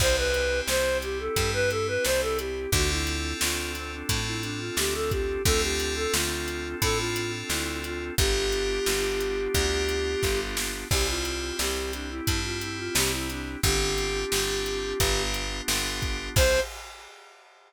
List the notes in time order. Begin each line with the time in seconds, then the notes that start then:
0.00 C2 C4 E4 G4 C5, kick, crash
0.17 B4
0.34 closed hi-hat
0.67 C2 C5, snare
1.02 G4, closed hi-hat
1.19 A4
1.36 G2 C4 E4 G4, kick, closed hi-hat
1.54 B4
1.70 A4, closed hi-hat
1.88 B4
2.05 C2 C5, snare
2.21 A4
2.38 G4, closed hi-hat
2.72 D2 C4 D4 F4 F#4 A4, kick, closed hi-hat
2.90 E4
3.07 closed hi-hat
3.41 D2 F4, snare
3.75 C4, closed hi-hat
3.92 D4
4.09 A2 C4 D4 F4 A4, kick, closed hi-hat
4.26 E4
4.43 D4, closed hi-hat
4.60 F4
4.77 D2 G4, snare
4.94 A4
5.11 G4, kick, closed hi-hat
5.45 D2 C4 D4 F4 A4, kick, closed hi-hat
5.62 G4
5.80 closed hi-hat
5.96 A4
6.13 D2 F4, snare
6.48 closed hi-hat
6.82 A2 C4 D4 F4 A4, kick, closed hi-hat
6.99 F4
7.16 closed hi-hat
7.50 D2 E4, snare
7.84 F4, closed hi-hat
8.18 G1 B3 D4 F4 G4, kick, closed hi-hat
8.52 closed hi-hat
8.86 G1, snare
9.20 closed hi-hat
9.54 D2 B3 D4 F4 G4, kick, closed hi-hat
9.89 closed hi-hat
10.23 G1, kick, snare
10.57 snare
10.90 C2 C4 E4 G4, kick, crash
11.08 F4
11.25 closed hi-hat
11.59 C2 G4, snare
11.93 D4, closed hi-hat
12.10 E4
12.27 G2 C4 E4 G4, kick, closed hi-hat
12.44 F4
12.61 E4, closed hi-hat
12.78 F4
12.95 C2 G4, snare
13.12 E4
13.30 D4, closed hi-hat
13.63 G1 C4 D4 F4 G4, kick, closed hi-hat
13.98 closed hi-hat
14.32 G1 C4 D4 F4 G4, snare
14.66 closed hi-hat
15.00 G1 B3 D4 F4 G4, kick, closed hi-hat
15.34 closed hi-hat
15.68 G1 B3 D4 F4 G4, snare
16.02 kick, closed hi-hat
16.36 C2 C4 E4 G4 C5, kick, crash